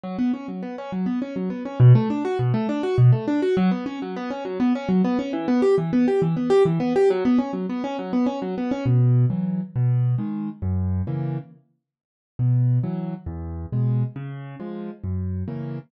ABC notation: X:1
M:6/8
L:1/8
Q:3/8=136
K:Bm
V:1 name="Acoustic Grand Piano"
F, B, C F, B, C | F, B, C F, B, C | B,, A, D F B,, A, | D F B,, A, D F |
F, B, C F, B, C | F, B, C F, B, C | E, B, G E, B, G | E, B, G E, B, G |
F, B, C F, B, C | F, B, C F, B, C | [K:B] B,,3 [E,F,]3 | B,,3 [D,G,]3 |
F,,3 [C,E,A,]3 | z6 | B,,3 [E,F,]3 | E,,3 [B,,G,]3 |
C,3 [^E,G,]3 | F,,3 [C,E,A,]3 |]